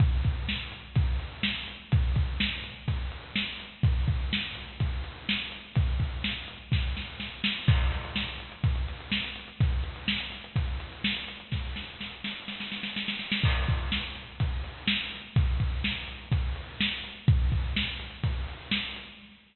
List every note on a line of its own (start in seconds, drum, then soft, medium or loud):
0.00 kick loud
0.00 closed hi-hat loud
0.24 kick medium
0.24 closed hi-hat medium
0.48 snare loud
0.72 closed hi-hat medium
0.96 kick loud
0.96 closed hi-hat loud
1.20 closed hi-hat medium
1.43 snare loud
1.68 closed hi-hat medium
1.92 kick loud
1.92 closed hi-hat loud
2.16 kick medium
2.16 closed hi-hat medium
2.40 snare loud
2.64 closed hi-hat medium
2.88 kick medium
2.88 closed hi-hat loud
3.12 closed hi-hat medium
3.36 snare loud
3.60 closed hi-hat medium
3.83 kick loud
3.83 closed hi-hat loud
4.08 kick medium
4.08 closed hi-hat medium
4.33 snare loud
4.55 closed hi-hat medium
4.80 kick medium
4.80 closed hi-hat loud
5.04 closed hi-hat medium
5.29 snare loud
5.52 closed hi-hat medium
5.75 kick loud
5.75 closed hi-hat loud
6.00 kick medium
6.00 closed hi-hat medium
6.24 snare loud
6.48 closed hi-hat medium
6.72 kick medium
6.72 snare medium
6.97 snare medium
7.20 snare medium
7.44 snare loud
7.68 kick loud
7.68 crash loud
7.81 closed hi-hat medium
7.92 closed hi-hat medium
8.05 closed hi-hat medium
8.16 snare loud
8.28 closed hi-hat medium
8.40 closed hi-hat medium
8.52 closed hi-hat medium
8.64 kick loud
8.64 closed hi-hat loud
8.76 closed hi-hat medium
8.88 closed hi-hat medium
9.00 closed hi-hat medium
9.12 snare loud
9.24 closed hi-hat medium
9.36 closed hi-hat medium
9.48 closed hi-hat medium
9.60 kick loud
9.60 closed hi-hat loud
9.72 closed hi-hat medium
9.84 closed hi-hat medium
9.96 closed hi-hat medium
10.08 snare loud
10.20 closed hi-hat medium
10.32 closed hi-hat medium
10.44 closed hi-hat medium
10.56 kick medium
10.56 closed hi-hat loud
10.68 closed hi-hat medium
10.80 closed hi-hat medium
10.93 closed hi-hat medium
11.04 snare loud
11.17 closed hi-hat medium
11.28 closed hi-hat medium
11.40 closed hi-hat medium
11.52 kick medium
11.52 snare medium
11.76 snare medium
12.01 snare medium
12.24 snare medium
12.48 snare medium
12.60 snare medium
12.72 snare medium
12.83 snare medium
12.96 snare medium
13.08 snare medium
13.19 snare medium
13.32 snare loud
13.44 kick loud
13.44 crash loud
13.68 kick medium
13.68 closed hi-hat medium
13.92 snare loud
14.15 closed hi-hat medium
14.40 kick medium
14.40 closed hi-hat loud
14.64 closed hi-hat medium
14.87 snare loud
15.12 closed hi-hat medium
15.36 kick loud
15.36 closed hi-hat loud
15.60 kick medium
15.60 closed hi-hat medium
15.84 snare loud
16.08 closed hi-hat medium
16.32 kick medium
16.32 closed hi-hat loud
16.56 closed hi-hat medium
16.80 snare loud
17.04 closed hi-hat medium
17.28 kick loud
17.28 closed hi-hat loud
17.52 kick medium
17.52 closed hi-hat medium
17.76 snare loud
18.00 closed hi-hat medium
18.23 kick medium
18.23 closed hi-hat loud
18.48 closed hi-hat medium
18.71 snare loud
18.96 closed hi-hat medium